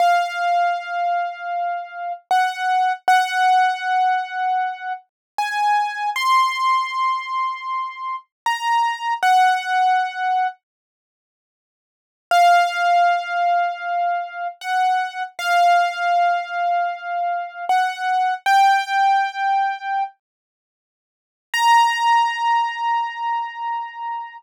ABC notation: X:1
M:4/4
L:1/8
Q:1/4=78
K:Bbm
V:1 name="Acoustic Grand Piano"
f6 g2 | g6 a2 | c'6 b2 | g4 z4 |
f6 g2 | f6 ^f2 | =g5 z3 | b8 |]